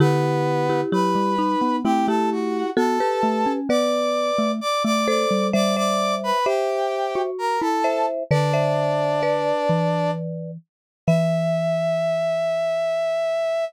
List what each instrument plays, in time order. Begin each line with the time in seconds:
0.00 xylophone D3, brass section B3 B4, marimba E4 G4
0.69 marimba E4 G4
0.92 xylophone F#3, marimba E4 G4, brass section B4 B5
1.15 xylophone G3
1.38 marimba D#4
1.62 xylophone B3
1.84 xylophone A3, marimba C4 E4, brass section G4 G5
2.08 xylophone A3, marimba E4 G4, brass section A4 A5
2.32 brass section F#4 F#5
2.77 xylophone B3, marimba F#4 A4, brass section A4 A5
3.00 marimba G4 B4
3.23 xylophone A3
3.46 xylophone C#4
3.69 xylophone B3, marimba B4 D5, brass section D5 D6
4.38 xylophone A3
4.61 brass section D5 D6
4.85 xylophone A3, brass section D5 D6
5.07 marimba A4 C5, brass section D5 D6
5.31 xylophone G3
5.53 xylophone G3, marimba C5 E5, brass section D5 D6
5.76 marimba C5 E5, brass section D5 D6
6.23 brass section B4 B5
6.46 xylophone G4, brass section G4 G5, marimba C5 E5
7.15 xylophone F#4
7.38 brass section A#4 A#5
7.61 xylophone E4, brass section A4 A5
7.84 marimba C5 E5
8.31 xylophone D3, brass section D4 D5, marimba B4 D5
8.53 marimba C5 E5
9.23 marimba B4 D5
9.69 xylophone E3
11.07 xylophone E3, brass section E5, marimba E5